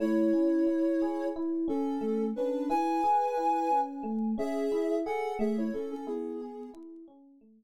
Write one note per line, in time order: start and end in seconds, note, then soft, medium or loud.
0.00 0.31 A3 medium
0.00 1.26 E4 medium
0.00 1.26 C#5 medium
0.33 0.64 C#4 medium
0.67 0.97 E4 medium
1.02 1.33 G#4 medium
1.36 1.67 E4 medium
1.68 1.98 C#4 medium
1.68 2.24 C#4 medium
1.68 2.24 A4 medium
2.01 2.32 A3 medium
2.36 2.68 C#4 medium
2.36 2.69 D4 medium
2.36 2.69 B4 medium
2.70 3.00 E4 medium
2.70 3.79 B4 medium
2.70 3.79 G#5 medium
3.04 3.34 G#4 medium
3.37 3.68 E4 medium
3.71 4.02 C#4 medium
4.03 4.34 A3 medium
4.38 4.68 C#4 medium
4.38 4.96 G#4 medium
4.38 4.96 E5 medium
4.72 5.02 E4 medium
5.06 5.37 G#4 medium
5.06 5.34 A4 medium
5.06 5.34 F#5 medium
5.39 5.70 A3 loud
5.39 5.57 G#4 medium
5.39 5.57 E5 medium
5.58 5.72 E4 medium
5.58 5.72 C#5 medium
5.73 5.90 C#4 medium
5.73 6.05 C#4 medium
5.73 5.90 A4 medium
5.91 6.06 C#4 medium
5.91 6.06 A4 medium
6.07 6.68 B3 medium
6.07 6.37 E4 medium
6.07 6.68 G#4 medium
6.41 6.72 G#4 medium
6.74 7.04 E4 medium
7.08 7.38 C#4 medium
7.41 7.64 A3 medium